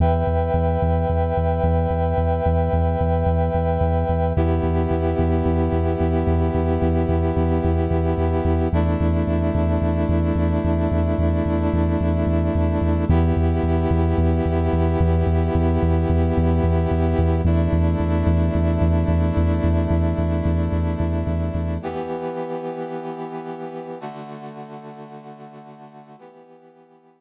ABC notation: X:1
M:4/4
L:1/8
Q:1/4=110
K:Edor
V:1 name="Brass Section"
[Beg]8- | [Beg]8 | [B,EG]8- | [B,EG]8 |
[A,DE]8- | [A,DE]8 | [B,EG]8- | [B,EG]8 |
[A,DE]8- | [A,DE]8 | [E,B,G]8 | [D,A,F]8 |
[E,B,G]8 |]
V:2 name="Synth Bass 2" clef=bass
E,, E,, E,, E,, E,, E,, E,, E,, | E,, E,, E,, E,, E,, E,, E,, E,, | E,, E,, E,, E,, E,, E,, E,, E,, | E,, E,, E,, E,, E,, E,, E,, E,, |
E,, E,, E,, E,, E,, E,, E,, E,, | E,, E,, E,, E,, E,, E,, E,, E,, | E,, E,, E,, E,, E,, E,, E,, E,, | E,, E,, E,, E,, E,, E,, E,, E,, |
E,, E,, E,, E,, E,, E,, E,, E,, | E,, E,, E,, E,, E,, E,, E,, E,, | z8 | z8 |
z8 |]